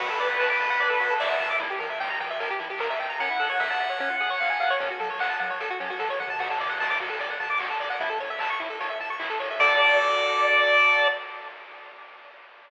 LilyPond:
<<
  \new Staff \with { instrumentName = "Lead 1 (square)" } { \time 4/4 \key d \major \tempo 4 = 150 b'2. e''4 | r1 | fis''1 | r1 |
r1 | r1 | d''1 | }
  \new Staff \with { instrumentName = "Lead 1 (square)" } { \time 4/4 \key d \major fis'16 a'16 d''16 fis''16 a''16 d'''16 a''16 fis''16 d''16 a'16 fis'16 a'16 d''16 fis''16 a''16 d'''16 | e'16 g'16 bes'16 e''16 g''16 bes''16 g''16 e''16 bes'16 g'16 e'16 g'16 bes'16 e''16 g''16 bes''16 | cis'16 e'16 a'16 cis''16 e''16 a''16 e''16 cis''16 cis'16 eis'16 gis'16 cis''16 eis''16 gis''16 eis''16 cis''16 | cis'16 fis'16 a'16 cis''16 fis''16 a''16 fis''16 cis''16 a'16 fis'16 cis'16 fis'16 a'16 cis''16 fis''16 a''16 |
fis'16 a'16 d''16 fis''16 a''16 d'''16 fis'16 a'16 d''16 fis''16 a''16 d'''16 fis'16 a'16 d''16 fis''16 | e'16 a'16 cis''16 e''16 a''16 cis'''16 e'16 a'16 cis''16 e''16 a''16 cis'''16 e'16 a'16 cis''16 e''16 | <fis' a' d''>1 | }
  \new Staff \with { instrumentName = "Synth Bass 1" } { \clef bass \time 4/4 \key d \major d,8 d8 d,8 d8 d,8 d8 d,8 d8 | e,8 e8 e,8 e8 e,8 e8 e,8 a,,8~ | a,,8 a,8 a,,8 a,8 cis,8 cis8 cis,8 cis8 | fis,8 fis8 fis,8 fis8 fis,8 fis8 e8 dis8 |
d,8 d8 d,8 d8 d,8 d8 d,8 d8 | a,,8 a,8 a,,8 a,8 a,,8 a,8 a,,8 a,8 | d,1 | }
  \new DrumStaff \with { instrumentName = "Drums" } \drummode { \time 4/4 <cymc bd>8 hho8 <hc bd>8 hho8 <hh bd>8 hho8 <bd sn>8 <hho sn>8 | <hh bd>8 hho8 <bd sn>8 hho8 <hh bd>8 hho8 <bd sn>8 <hho sn>8 | <hh bd>8 hho8 <bd sn>8 hho8 <hh bd>8 hho8 <hc bd>8 <hho sn>8 | <hh bd>8 hho8 <hc bd>8 hho8 <hh bd>8 hho8 <bd sn>8 toml8 |
<cymc bd>8 hho8 <bd sn>8 hho8 <hh bd>8 hho8 <hc bd>8 <hho sn>8 | <hh bd>8 hho8 <hc bd>8 hho8 <hh bd>8 hho8 <hc bd>8 <hho sn>8 | <cymc bd>4 r4 r4 r4 | }
>>